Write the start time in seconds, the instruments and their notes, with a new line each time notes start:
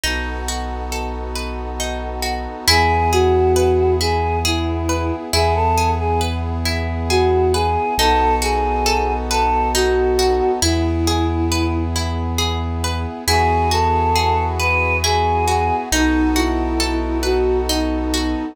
0.03 synth bass 2 B1, brass section B3 D#4 F#4 A4, pizzicato strings D#4
0.48 pizzicato strings F#4
0.92 pizzicato strings A4
1.35 pizzicato strings B4
1.80 pizzicato strings D#4
2.22 pizzicato strings F#4
2.68 synth bass 2 E2, brass section B3 E4 G#4, pizzicato strings E4, choir aahs G#4
3.12 choir aahs F#4, pizzicato strings G#4
3.56 pizzicato strings B4
4.00 pizzicato strings E4, choir aahs G#4
4.45 choir aahs E4, pizzicato strings G#4
4.89 pizzicato strings B4
5.33 synth bass 2 E2, brass section B3 E4 G#4, pizzicato strings E4, choir aahs G#4
5.55 choir aahs A4
5.78 pizzicato strings G#4
5.99 choir aahs G#4
6.21 pizzicato strings B4
6.65 pizzicato strings E4
7.10 choir aahs F#4, pizzicato strings G#4
7.53 choir aahs G#4, pizzicato strings B4
7.97 synth bass 2 B1, brass section B3 D#4 F#4 A4, pizzicato strings D#4, choir aahs A4
8.42 pizzicato strings F#4, choir aahs G#4
8.86 pizzicato strings A4
9.30 choir aahs A4, pizzicato strings B4
9.74 pizzicato strings D#4, choir aahs F#4
10.19 pizzicato strings F#4
10.62 synth bass 2 E2, brass section B3 E4 G#4, pizzicato strings E4, choir aahs E4
11.07 pizzicato strings G#4
11.52 pizzicato strings B4
11.96 pizzicato strings E4
12.38 pizzicato strings G#4
12.84 pizzicato strings B4
13.27 synth bass 2 E2, brass section B3 E4 F#4 G#4, pizzicato strings E4, choir aahs G#4
13.71 pizzicato strings F#4, choir aahs A4
14.15 pizzicato strings G#4
14.59 choir aahs B4, pizzicato strings B4
15.04 pizzicato strings E4, choir aahs G#4
15.48 pizzicato strings F#4
15.92 synth bass 2 B1, brass section B3 D#4 F#4 A4, choir aahs D#4, pizzicato strings D#4
16.36 choir aahs E4, pizzicato strings F#4
16.80 pizzicato strings A4
17.23 choir aahs F#4, pizzicato strings B4
17.68 choir aahs D#4, pizzicato strings D#4
18.14 pizzicato strings F#4